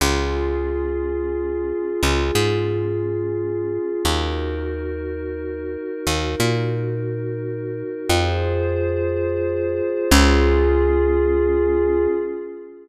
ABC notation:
X:1
M:3/4
L:1/8
Q:1/4=89
K:Db
V:1 name="Pad 5 (bowed)"
[DFA]6- | [DFA]6 | [EGB]6- | [EGB]6 |
[FAc]6 | [DFA]6 |]
V:2 name="Electric Bass (finger)" clef=bass
D,,6 | D,, A,,5 | E,,6 | E,, B,,5 |
F,,6 | D,,6 |]